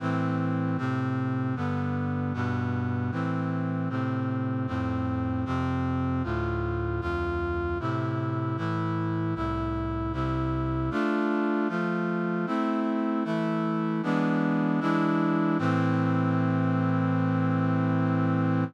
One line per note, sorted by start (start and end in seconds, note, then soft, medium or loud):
0.00 0.77 A2 medium
0.00 0.77 E3 medium
0.00 0.77 C4 medium
0.78 1.55 A2 medium
0.78 1.55 C3 medium
0.78 1.55 C4 medium
1.56 2.33 G2 medium
1.56 2.33 D3 medium
1.56 2.33 B3 medium
2.34 3.11 G2 medium
2.34 3.11 B2 medium
2.34 3.11 B3 medium
3.12 3.89 A2 medium
3.12 3.89 E3 medium
3.12 3.89 C4 medium
3.89 4.67 A2 medium
3.89 4.67 C3 medium
3.89 4.67 C4 medium
4.67 5.44 F2 medium
4.67 5.44 A2 medium
4.67 5.44 C4 medium
5.45 6.23 F2 medium
5.45 6.23 C3 medium
5.45 6.23 C4 medium
6.24 7.00 D2 medium
6.24 7.01 A2 medium
6.24 7.00 F4 medium
7.01 7.78 D2 medium
7.01 7.78 F2 medium
7.01 7.78 F4 medium
7.80 8.56 A2 medium
7.80 8.57 C3 medium
7.80 8.56 E4 medium
8.57 9.34 A2 medium
8.57 9.34 E3 medium
8.57 9.34 E4 medium
9.35 10.12 C2 medium
9.35 10.12 A2 medium
9.35 10.12 E4 medium
10.13 10.90 C2 medium
10.13 10.90 C3 medium
10.13 10.90 E4 medium
10.91 11.68 A3 medium
10.91 11.68 D4 medium
10.91 11.68 F4 medium
11.69 12.46 F3 medium
11.69 12.46 A3 medium
11.69 12.46 F4 medium
12.46 13.24 A3 medium
12.46 13.24 C4 medium
12.46 13.24 E4 medium
13.24 14.02 E3 medium
13.24 14.02 A3 medium
13.24 14.02 E4 medium
14.03 14.80 E3 medium
14.03 14.80 G#3 medium
14.03 14.80 B3 medium
14.03 14.80 D4 medium
14.80 15.57 E3 medium
14.80 15.57 G#3 medium
14.80 15.57 D4 medium
14.80 15.57 E4 medium
15.58 18.64 A2 loud
15.58 18.64 E3 loud
15.58 18.64 C4 loud